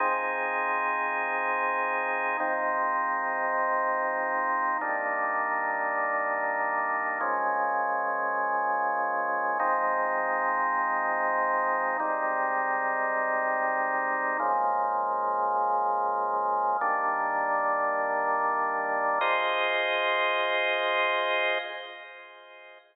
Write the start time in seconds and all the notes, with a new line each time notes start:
0.00 F3 C4 D#4 G#4
2.40 G#2 F3 C4 D#4
4.81 G3 A#3 D4 D#4
7.21 A#2 F3 G#3 C#4
9.60 F3 G#3 C4 D#4
12.00 G#2 G3 C4 D#4
14.39 C#3 F3 G#3 A#3
16.81 D#3 G3 A#3 D4
19.21 F4 G#4 C5 D#5